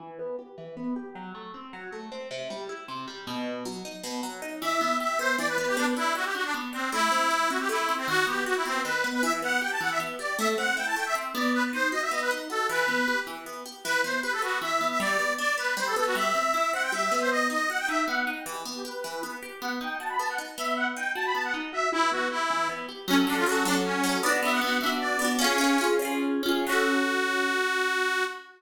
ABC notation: X:1
M:3/4
L:1/16
Q:1/4=156
K:Em
V:1 name="Accordion"
z12 | z12 | z12 | z12 |
e4 e2 c2 d B B G | D z E2 F G F D z2 C2 | E6 F G E3 C | F2 G2 F E C2 B3 B |
e z f2 g a f e z2 d2 | e z f2 g a g e z2 d2 | B z c2 ^d e d B z2 A2 | B6 z6 |
B2 c2 B A F2 e3 e | d4 d2 B2 c A A F | e6 f g e3 c | ^d2 d2 f g e2 f3 g |
G z2 G B6 z2 | f z g2 a b a f z2 e2 | f z g2 a b a f z2 e2 | E2 F2 E4 z4 |
[K:F#m] C z D ^E F2 D z C4 | d z e f f2 e z d4 | "^rit." C6 z6 | F12 |]
V:2 name="Orchestral Harp"
E,2 B,2 G2 E,2 B,2 G2 | F,2 A,2 C2 F,2 A,2 C2 | C,2 G,2 E2 C,2 G,2 B,,2- | B,,2 F,2 ^D2 B,,2 F,2 D2 |
E,2 B,2 G2 B,2 E,2 B,2 | B,2 D2 G2 D2 B,2 D2 | A,2 C2 E2 C2 A,2 C2 | ^D,2 B,2 F2 B,2 D,2 B,2 |
E,2 B,2 G2 E,2 B,2 G2 | A,2 C2 E2 A,2 C2 B,2- | B,2 ^D2 F2 B,2 D2 F2 | E,2 B,2 G2 E,2 B,2 G2 |
E,2 B,2 G2 B,2 E,2 B,2 | G,2 B,2 D2 B,2 G,2 B,2 | G,2 C2 E2 C2 G,2 B,2- | B,2 ^D2 F2 D2 B,2 D2 |
E,2 B,2 G2 E,2 B,2 G2 | B,2 ^D2 F2 B,2 D2 B,2- | B,2 ^D2 F2 B,2 D2 F2 | E,2 B,2 G2 E,2 B,2 G2 |
[K:F#m] [F,CA]2 [F,CA]2 [F,CA]2 [F,CA]4 [F,CA]2 | [B,DF]2 [B,DF]2 [B,DF]2 [B,DF]4 [B,DF]2 | "^rit." [C^EG]2 [CEG]2 [CEG]2 [CEG]4 [CEG]2 | [F,CA]12 |]